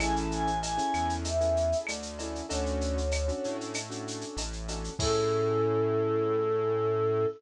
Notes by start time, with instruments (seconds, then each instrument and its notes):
0.00 synth bass 1 A1, acoustic grand piano C#4 E4 G#4 A4, choir aahs G#5, cowbell, claves, shaker
0.16 choir aahs A5, shaker
0.31 choir aahs G#5, shaker
0.47 shaker
0.63 choir aahs G#5, cowbell, shaker
0.77 acoustic grand piano C#4 E4 G#4 A4, shaker
0.94 synth bass 1 E2, claves, shaker
1.09 shaker
1.24 choir aahs E5, cowbell, shaker
1.41 acoustic grand piano C#4 E4 G#4 A4, shaker
1.57 shaker
1.72 shaker
1.86 synth bass 1 D2, choir aahs D5, cowbell, claves, shaker
2.02 shaker
2.19 acoustic grand piano C#4 E4 G#4 A4, cowbell, shaker
2.35 shaker
2.49 synth bass 1 D2, acoustic grand piano C#4 D4 F#4 A4, choir aahs C#5, cowbell, shaker
2.66 shaker
2.81 shaker
2.98 shaker
3.11 cowbell, claves, shaker
3.28 acoustic grand piano C#4 D4 F#4 A4, shaker
3.44 synth bass 1 A2, shaker
3.61 shaker
3.74 cowbell, claves, shaker
3.90 acoustic grand piano C#4 D4 F#4 A4, shaker
4.08 shaker
4.21 shaker
4.37 synth bass 1 A1, cowbell, shaker
4.53 shaker
4.68 acoustic grand piano C#4 D4 F#4 A4, cowbell, shaker
4.84 shaker
4.99 synth bass 1 A2, acoustic grand piano C#4 E4 G#4 A4, choir aahs A4, kick, crash